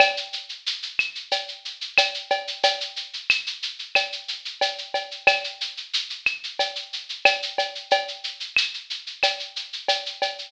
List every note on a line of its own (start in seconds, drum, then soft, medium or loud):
0.00 cowbell loud
0.00 claves loud
0.00 shaker loud
0.17 shaker medium
0.33 shaker medium
0.49 shaker medium
0.66 shaker loud
0.82 shaker medium
0.99 claves medium
0.99 shaker medium
1.15 shaker medium
1.31 cowbell medium
1.31 shaker medium
1.48 shaker medium
1.65 shaker medium
1.81 shaker medium
1.98 cowbell medium
1.98 claves medium
1.98 shaker loud
2.14 shaker medium
2.30 cowbell medium
2.30 shaker medium
2.47 shaker medium
2.63 cowbell medium
2.63 shaker loud
2.80 shaker medium
2.96 shaker medium
3.13 shaker medium
3.30 claves medium
3.30 shaker loud
3.46 shaker medium
3.63 shaker medium
3.79 shaker medium
3.95 cowbell medium
3.95 claves medium
3.95 shaker medium
4.12 shaker medium
4.28 shaker medium
4.45 shaker medium
4.61 cowbell medium
4.61 shaker medium
4.78 shaker medium
4.94 cowbell medium
4.94 shaker medium
5.11 shaker medium
5.27 cowbell medium
5.27 claves loud
5.27 shaker loud
5.44 shaker medium
5.61 shaker medium
5.77 shaker medium
5.93 shaker loud
6.10 shaker medium
6.26 claves medium
6.26 shaker medium
6.44 shaker medium
6.59 cowbell medium
6.59 shaker medium
6.76 shaker medium
6.93 shaker medium
7.09 shaker medium
7.25 cowbell medium
7.25 claves medium
7.25 shaker loud
7.42 shaker medium
7.58 cowbell medium
7.58 shaker medium
7.75 shaker medium
7.91 cowbell medium
7.91 shaker medium
8.08 shaker medium
8.24 shaker medium
8.40 shaker medium
8.56 claves medium
8.56 shaker loud
8.74 shaker medium
8.90 shaker medium
9.07 shaker medium
9.23 cowbell medium
9.23 claves medium
9.23 shaker loud
9.39 shaker medium
9.56 shaker medium
9.73 shaker medium
9.88 cowbell medium
9.88 shaker loud
10.06 shaker medium
10.22 cowbell medium
10.22 shaker medium
10.38 shaker medium